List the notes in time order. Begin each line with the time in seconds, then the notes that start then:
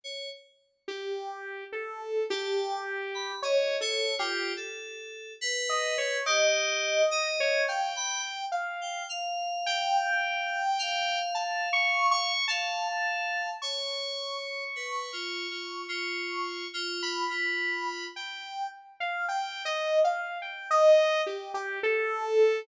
0.04 C#5
0.88 G4
1.72 A4
2.30 G4 A5
3.15 B5
3.42 C#5 D#5
3.81 A4 C#5
4.19 F4 G4
4.57 A4
5.41 B4
5.69 D#5
5.98 C#5
6.26 G4 D#5
7.11 D#5
7.40 C#5
7.68 F5 G5
7.96 B5
8.52 F5
8.81 G5
9.09 F5
9.66 G5
10.79 F5
11.35 A5
11.73 C#6
12.11 C#6
12.48 F5 A5
13.62 C#5 C#6
14.76 B4
15.13 F4
15.51 F4
15.88 F4
16.74 F4
17.03 B5
17.30 F4
18.16 G5
19.00 F5
19.29 G5
19.65 D#5
20.04 F5
20.42 G5
20.71 D#5
21.26 G4
21.54 G4
21.83 A4